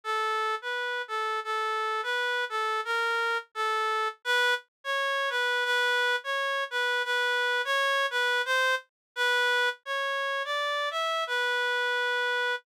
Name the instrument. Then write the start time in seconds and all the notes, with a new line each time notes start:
clarinet
0.04 A4
0.62 B4
1.08 A4
1.44 A4
2.03 B4
2.49 A4
2.85 A#4
3.55 A4
4.25 B4
4.84 C#5
5.30 B4
5.65 B4
6.24 C#5
6.71 B4
7.05 B4
7.65 C#5
8.11 B4
8.45 C5
9.16 B4
9.85 C#5
10.45 D5
10.91 E5
11.27 B4